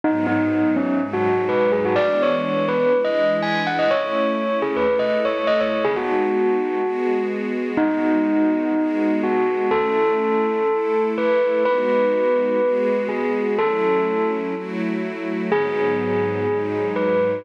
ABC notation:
X:1
M:4/4
L:1/16
Q:1/4=124
K:G#phr
V:1 name="Tubular Bells"
D2 D4 C2 z F3 B2 G F | =d2 c4 B2 z ^d3 g2 f d | c6 G B2 d z c2 d c z | G F11 z4 |
D12 F4 | A12 B4 | B12 G4 | A6 z10 |
G12 B4 |]
V:2 name="String Ensemble 1"
[G,,F,B,D]8 [G,,F,G,D]8 | [E,G,B,=D]8 [E,G,DE]8 | [A,CE]8 [A,EA]8 | [G,B,DF]8 [G,B,FG]8 |
[G,B,DF]8 [G,B,FG]8 | [A,CE]8 [A,EA]8 | [G,B,DF]8 [G,B,FG]8 | [F,A,CE]8 [F,A,EF]8 |
[G,,F,B,D]8 [G,,F,G,D]8 |]